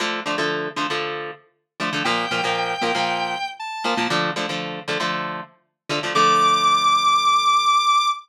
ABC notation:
X:1
M:4/4
L:1/16
Q:1/4=117
K:Dm
V:1 name="Lead 1 (square)"
z16 | g12 a4 | z16 | d'16 |]
V:2 name="Overdriven Guitar"
[D,F,A,]2 [D,F,A,] [D,F,A,]3 [D,F,A,] [D,F,A,]7 [D,F,A,] [D,F,A,] | [B,,F,B,]2 [B,,F,B,] [B,,F,B,]3 [B,,F,B,] [B,,F,B,]7 [B,,F,B,] [B,,F,B,] | [D,F,A,]2 [D,F,A,] [D,F,A,]3 [D,F,A,] [D,F,A,]7 [D,F,A,] [D,F,A,] | [D,F,A,]16 |]